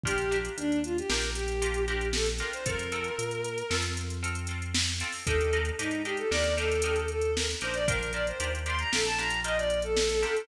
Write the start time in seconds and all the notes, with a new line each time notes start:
0.03 A#1 D4 F4 G4 A#4, kick, closed hi-hat
0.18 closed hi-hat
0.31 D4 F4 G4 A#4, closed hi-hat
0.45 closed hi-hat
0.57 D#2 D4, closed hi-hat
0.72 closed hi-hat
0.84 F4, closed hi-hat
0.98 G4, closed hi-hat
1.08 A#1 D4 F4 G4 A#4, snare
1.22 closed hi-hat
1.35 G4, closed hi-hat
1.48 closed hi-hat
1.62 D4 F4 G4 A#4, closed hi-hat
1.74 closed hi-hat
1.87 D4 F4 G4 A#4, closed hi-hat
2.01 closed hi-hat
2.13 A4, snare
2.26 closed hi-hat
2.39 D4 F4 G4 A#4, closed hi-hat
2.53 C5, closed hi-hat
2.66 F2 C4 F4 A4 A#4, kick, closed hi-hat
2.79 closed hi-hat
2.92 C4 F4 A4, closed hi-hat
3.04 closed hi-hat
3.18 A#2, closed hi-hat
3.31 closed hi-hat
3.44 closed hi-hat
3.58 closed hi-hat
3.70 F2 C4 F4 A4, snare
3.82 closed hi-hat
3.97 closed hi-hat
4.10 closed hi-hat
4.23 C4 F4 A4, closed hi-hat
4.35 closed hi-hat
4.47 C4 F4 A4, closed hi-hat
4.62 closed hi-hat
4.74 snare
4.87 closed hi-hat
5.00 C4 F4 A4, closed hi-hat
5.12 open hi-hat
5.26 D#2 D4 D#4 G4 A4 A#4, kick, closed hi-hat
5.41 closed hi-hat
5.53 D4 D#4 G4 A#4, closed hi-hat
5.65 closed hi-hat
5.79 G#2 D4 D#4 G4 A#4, closed hi-hat
5.91 closed hi-hat
6.05 D4 D#4 G4 A#4, closed hi-hat
6.17 A4, closed hi-hat
6.31 D#2 D4 D#4 G4 A#4 D5, snare
6.44 closed hi-hat
6.57 D4 D#4 G4 A4 A#4, closed hi-hat
6.72 closed hi-hat
6.82 D4 D#4 G4 A#4, closed hi-hat
6.96 closed hi-hat
7.08 A4, closed hi-hat
7.22 closed hi-hat
7.36 A#4, snare
7.50 closed hi-hat
7.61 A#1 D4 D#4 G4 A#4 C5, closed hi-hat
7.74 D5, closed hi-hat
7.88 D4 F4 G4 A#4, kick, closed hi-hat
8.03 closed hi-hat
8.13 D4 F4 G4 A#4 D5, closed hi-hat
8.27 C5, closed hi-hat
8.40 D#2 D4 F4 G4 A#4, closed hi-hat
8.55 closed hi-hat
8.66 D4 F4 G4 A#4 C6, closed hi-hat
8.79 A#5, closed hi-hat
8.92 A#1 D4 F4 G4 A4 A#4, snare
9.05 A5, closed hi-hat
9.18 D4 F4 G4 A#4 A#5, closed hi-hat
9.30 closed hi-hat
9.44 D4 F4 G4 A#4 D#5, closed hi-hat
9.57 D5, closed hi-hat
9.70 closed hi-hat
9.82 A4, closed hi-hat
9.97 snare
10.09 closed hi-hat
10.23 D4 F4 G4 A#4, closed hi-hat
10.37 closed hi-hat